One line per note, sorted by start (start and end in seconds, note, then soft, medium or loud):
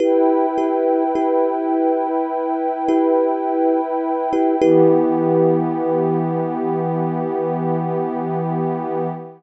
0.00 0.46 E4 medium
0.00 4.58 E4 loud
0.00 0.46 G4 medium
0.00 0.46 B4 medium
0.00 4.58 B4 medium
0.00 4.58 G5 loud
0.58 1.04 E4 medium
0.58 1.04 G4 medium
0.58 1.04 B4 medium
1.15 2.08 E4 medium
1.15 2.08 G4 medium
1.15 2.08 B4 medium
2.88 3.81 E4 medium
2.88 3.81 G4 medium
2.88 3.81 B4 medium
4.33 4.56 E4 medium
4.33 4.56 G4 medium
4.33 4.56 B4 medium
4.62 9.07 E3 loud
4.62 9.07 B3 loud
4.62 9.07 E4 loud
4.62 9.07 G4 loud
4.62 9.07 B4 medium